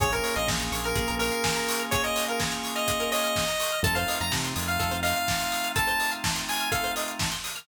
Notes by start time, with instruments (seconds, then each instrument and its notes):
0.00 synth bass 1 A#1, drawbar organ A#3 C#4 F4 G#4, pizzicato strings G#4, lead 1 (square) C#5, kick, closed hi-hat
0.12 pizzicato strings A#4, lead 1 (square) A#4, closed hi-hat
0.24 pizzicato strings C#5, open hi-hat
0.36 synth bass 1 A#1, lead 1 (square) D#5, pizzicato strings F5, closed hi-hat
0.48 synth bass 1 A#1, pizzicato strings G#5, kick, snare
0.60 pizzicato strings A#5, closed hi-hat
0.72 synth bass 1 A#1, pizzicato strings C#6, open hi-hat
0.84 lead 1 (square) A#4, pizzicato strings F6, closed hi-hat
0.95 synth bass 1 A#1, pizzicato strings G#4, kick, closed hi-hat
1.08 synth bass 1 A#1, pizzicato strings A#4, closed hi-hat
1.19 lead 1 (square) A#4, pizzicato strings C#5, open hi-hat
1.32 pizzicato strings F5, closed hi-hat
1.44 pizzicato strings G#5, kick, snare
1.56 pizzicato strings A#5, closed hi-hat
1.68 pizzicato strings C#6, open hi-hat
1.79 pizzicato strings F6, closed hi-hat
1.91 pizzicato strings G#4, lead 1 (square) C#5, kick, closed hi-hat
2.04 pizzicato strings A#4, lead 1 (square) D#5, closed hi-hat
2.16 pizzicato strings C#5, open hi-hat
2.28 lead 1 (square) A#4, pizzicato strings F5, closed hi-hat
2.40 pizzicato strings G#5, kick, snare
2.52 pizzicato strings A#5, closed hi-hat
2.64 pizzicato strings C#6, open hi-hat
2.75 lead 1 (square) D#5, pizzicato strings F6, closed hi-hat
2.88 pizzicato strings G#4, kick, closed hi-hat
3.00 pizzicato strings A#4, closed hi-hat
3.12 pizzicato strings C#5, lead 1 (square) D#5, open hi-hat
3.24 pizzicato strings F5, closed hi-hat
3.36 pizzicato strings G#5, kick, snare
3.48 pizzicato strings A#5, closed hi-hat
3.60 pizzicato strings C#6, open hi-hat
3.72 pizzicato strings F6, closed hi-hat
3.83 synth bass 1 F2, drawbar organ A3 C4 D#4 F4, pizzicato strings A4, lead 1 (square) A5, kick, closed hi-hat
3.95 pizzicato strings C5, lead 1 (square) F5, closed hi-hat
4.08 pizzicato strings D#5, open hi-hat
4.20 synth bass 1 F2, pizzicato strings F5, lead 1 (square) A#5, closed hi-hat
4.31 synth bass 1 C3, pizzicato strings A5, kick, snare
4.45 pizzicato strings C6, closed hi-hat
4.56 synth bass 1 F2, pizzicato strings D#6, open hi-hat
4.68 lead 1 (square) F5, pizzicato strings F6, closed hi-hat
4.79 synth bass 1 F2, pizzicato strings A4, kick, closed hi-hat
4.91 synth bass 1 F2, pizzicato strings C5, closed hi-hat
5.03 pizzicato strings D#5, lead 1 (square) F5, open hi-hat
5.16 pizzicato strings F5, closed hi-hat
5.28 pizzicato strings A5, kick, snare
5.40 pizzicato strings C6, closed hi-hat
5.52 pizzicato strings D#6, open hi-hat
5.64 pizzicato strings F6, closed hi-hat
5.76 pizzicato strings A4, lead 1 (square) A5, kick, closed hi-hat
5.88 pizzicato strings C5, closed hi-hat
6.00 pizzicato strings D#5, open hi-hat
6.12 pizzicato strings F5, closed hi-hat
6.24 pizzicato strings A5, kick, snare
6.36 pizzicato strings C6, closed hi-hat
6.48 lead 1 (square) G#5, pizzicato strings D#6, open hi-hat
6.60 pizzicato strings F6, closed hi-hat
6.72 pizzicato strings A4, lead 1 (square) F5, kick, closed hi-hat
6.84 pizzicato strings C5, closed hi-hat
6.96 pizzicato strings D#5, open hi-hat
7.08 pizzicato strings F5, closed hi-hat
7.19 pizzicato strings A5, kick, snare
7.32 pizzicato strings C6, closed hi-hat
7.44 pizzicato strings D#6, open hi-hat
7.56 pizzicato strings F6, closed hi-hat